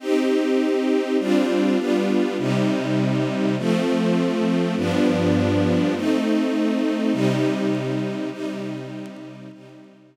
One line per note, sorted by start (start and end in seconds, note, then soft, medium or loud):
0.00 1.17 C4 medium
0.00 1.17 D#4 medium
0.00 1.17 G4 loud
1.19 1.78 G3 medium
1.19 1.78 C4 medium
1.19 1.78 D4 loud
1.19 1.78 F4 medium
1.78 2.37 G3 medium
1.78 2.37 B3 medium
1.78 2.37 D4 medium
1.78 2.37 F4 medium
2.38 3.56 C3 loud
2.38 3.56 G3 medium
2.38 3.56 D#4 medium
3.58 4.75 F3 loud
3.58 4.75 A3 loud
3.58 4.75 C4 medium
4.77 5.94 G2 medium
4.77 5.94 F3 medium
4.77 5.94 B3 medium
4.77 5.94 D4 loud
5.95 7.13 A3 medium
5.95 7.13 C4 medium
5.95 7.12 D#4 loud
7.12 8.30 C3 medium
7.12 8.30 G3 loud
7.12 8.30 D#4 loud
8.31 9.49 C3 medium
8.31 9.49 G3 loud
8.31 9.49 D#4 loud
9.52 10.16 C3 medium
9.52 10.16 G3 medium
9.52 10.16 D#4 loud